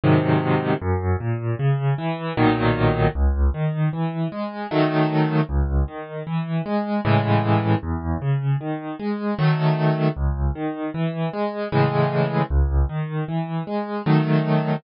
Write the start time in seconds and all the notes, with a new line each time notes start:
0.04 G#2 C3 D#3 F#3
0.82 F#2
1.20 A#2
1.59 C#3
1.98 E3
2.37 B1 A#2 D#3 F#3
3.15 C#2
3.54 D#3
3.93 E3
4.32 G#3
4.71 D#3 F#3 A3
5.49 C#2
5.88 D#3
6.27 E3
6.66 G#3
7.05 A2 C#3 E3 G#3
7.83 E2
8.22 C#3
8.61 D#3
9.00 G#3
9.39 D#3 F#3 A3
10.17 C#2
10.56 D#3
10.94 E3
11.33 G#3
11.72 A2 C#3 E3 G#3
12.50 C#2
12.89 D#3
13.28 E3
13.67 G#3
14.06 D#3 F#3 A3